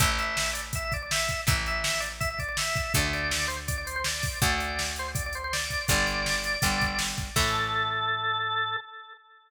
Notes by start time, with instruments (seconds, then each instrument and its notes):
0.00 electric bass (finger) A1, acoustic guitar (steel) E3 A3, drawbar organ E5, kick, closed hi-hat
0.18 drawbar organ E5, closed hi-hat
0.37 snare
0.53 drawbar organ D5, closed hi-hat
0.73 drawbar organ E5, kick, closed hi-hat
0.84 drawbar organ E5
0.92 drawbar organ D5, kick, closed hi-hat
1.02 drawbar organ D5
1.11 drawbar organ E5, snare
1.28 kick, closed hi-hat
1.47 electric bass (finger) A1, acoustic guitar (steel) E3 A3, drawbar organ E5, kick, closed hi-hat
1.66 drawbar organ E5, closed hi-hat
1.84 snare
2.00 drawbar organ D5, closed hi-hat
2.20 drawbar organ E5, kick, closed hi-hat
2.30 drawbar organ E5
2.39 drawbar organ D5, kick, closed hi-hat
2.49 drawbar organ D5
2.57 drawbar organ E5, snare
2.76 kick, closed hi-hat
2.94 electric bass (finger) D2, acoustic guitar (steel) D3 A3, drawbar organ D5, kick, closed hi-hat
3.13 drawbar organ D5, closed hi-hat
3.31 snare
3.48 drawbar organ C5, closed hi-hat
3.68 drawbar organ D5, kick, closed hi-hat
3.78 drawbar organ D5
3.87 drawbar organ C5, closed hi-hat
3.96 drawbar organ C5
4.04 drawbar organ D5, snare
4.23 kick, open hi-hat
4.42 electric bass (finger) D2, acoustic guitar (steel) D3 A3, drawbar organ D5, kick, closed hi-hat
4.58 drawbar organ D5, closed hi-hat
4.79 snare
4.96 drawbar organ C5, closed hi-hat
5.15 drawbar organ D5, kick, closed hi-hat
5.26 drawbar organ D5
5.33 drawbar organ C5, closed hi-hat
5.44 drawbar organ C5
5.53 drawbar organ D5, snare
5.70 kick, closed hi-hat
5.88 electric bass (finger) G1, acoustic guitar (steel) D3 G3, drawbar organ D5, kick, closed hi-hat
6.07 closed hi-hat
6.26 snare
6.44 closed hi-hat
6.62 electric bass (finger) G1, acoustic guitar (steel) D3 G3, kick, closed hi-hat
6.81 kick, closed hi-hat
6.99 snare
7.18 kick, closed hi-hat
7.36 electric bass (finger) A2, acoustic guitar (steel) E3 A3, drawbar organ A4, kick, crash